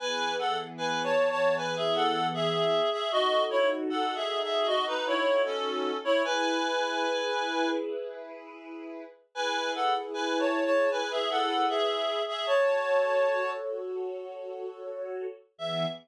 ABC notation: X:1
M:4/4
L:1/16
Q:1/4=77
K:E
V:1 name="Clarinet"
[Bg]2 [Af] z (3[Bg]2 [ca]2 [ca]2 [Bg] [Ge] [Af]2 [Ge]3 [Ge] | [Fd]2 [Ec] z (3[Af]2 [Ge]2 [Ge]2 [Fd] [DB] [Ec]2 [CA]3 [Ec] | [Bg]8 z8 | [Bg]2 [Af] z (3[Bg]2 [ca]2 [ca]2 [Bg] [Ge] [Af]2 [Ge]3 [Ge] |
[ca]6 z10 | e4 z12 |]
V:2 name="String Ensemble 1"
[E,B,G]16 | [DFA]16 | [EGB]16 | [EGB]16 |
[FAc]16 | [E,B,G]4 z12 |]